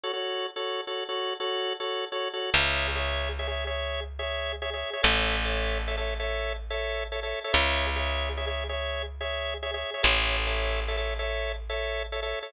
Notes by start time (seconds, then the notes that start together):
0.03 F#4 A4 C#5
0.13 F#4 A4 C#5
0.56 F#4 A4 C#5
0.87 F#4 A4 C#5
1.09 F#4 A4 C#5
1.40 F#4 A4 C#5
1.80 F#4 A4 C#5
2.12 F#4 A4 C#5
2.33 F#4 A4 C#5
2.54 C#2 G#4 C#5 E5
2.95 G#4 C#5 E5
3.39 G#4 C#5 E5
3.48 G#4 C#5 E5
3.67 G#4 C#5 E5
4.19 G#4 C#5 E5
4.62 G#4 C#5 E5
4.74 G#4 C#5 E5
4.93 G#4 C#5 E5
5.03 A1 A4 C#5 E5
5.45 A4 C#5 E5
5.88 A4 C#5 E5
5.97 A4 C#5 E5
6.20 A4 C#5 E5
6.70 A4 C#5 E5
7.12 A4 C#5 E5
7.23 A4 C#5 E5
7.44 A4 C#5 E5
7.53 C#2 G#4 C#5 E5
7.96 G#4 C#5 E5
8.37 G#4 C#5 E5
8.47 G#4 C#5 E5
8.69 G#4 C#5 E5
9.21 G#4 C#5 E5
9.63 G#4 C#5 E5
9.74 G#4 C#5 E5
9.94 G#4 C#5 E5
10.03 A1 A4 C#5 E5
10.47 A4 C#5 E5
10.88 A4 C#5 E5
10.97 A4 C#5 E5
11.19 A4 C#5 E5
11.70 A4 C#5 E5
12.12 A4 C#5 E5
12.23 A4 C#5 E5
12.43 A4 C#5 E5